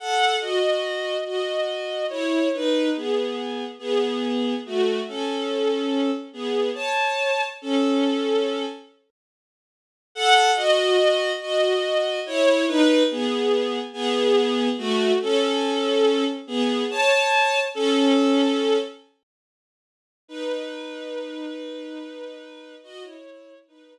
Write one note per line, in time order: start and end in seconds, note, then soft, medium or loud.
0.00 0.36 A4 medium
0.00 0.36 F#5 medium
0.41 1.17 F#4 medium
0.41 1.17 D#5 medium
1.26 2.05 F#4 medium
1.26 2.05 D#5 medium
2.10 2.48 E4 medium
2.10 2.48 C#5 medium
2.54 2.89 D#4 medium
2.54 2.89 B4 medium
2.96 3.65 B3 medium
2.96 3.65 G#4 medium
3.79 4.54 B3 medium
3.79 4.54 G#4 medium
4.66 5.00 A3 medium
4.66 5.00 F#4 medium
5.08 6.11 C#4 medium
5.08 6.11 A4 medium
6.33 6.70 B3 medium
6.33 6.70 G#4 medium
6.74 7.43 C#5 medium
6.74 7.43 A5 medium
7.62 8.65 C#4 medium
7.62 8.65 A4 medium
10.15 10.51 A4 loud
10.15 10.51 F#5 loud
10.56 11.32 F#4 medium
10.56 11.32 D#5 loud
11.41 12.20 F#4 medium
11.41 12.20 D#5 medium
12.26 12.65 E4 medium
12.26 12.65 C#5 loud
12.68 13.03 D#4 loud
12.68 13.03 B4 loud
13.11 13.79 B3 medium
13.11 13.79 G#4 medium
13.93 14.68 B3 medium
13.93 14.68 G#4 loud
14.78 15.12 A3 medium
14.78 15.12 F#4 loud
15.22 16.24 C#4 medium
15.22 16.24 A4 loud
16.47 16.84 B3 medium
16.47 16.84 G#4 medium
16.90 17.59 C#5 medium
16.90 17.59 A5 loud
17.74 18.78 C#4 loud
17.74 18.78 A4 loud
20.28 22.75 D#4 medium
20.28 22.75 B4 medium
22.83 23.03 F#4 medium
22.83 23.03 D#5 loud
23.01 23.54 E4 medium
23.01 23.54 C#5 medium
23.68 23.98 D#4 medium
23.68 23.98 B4 medium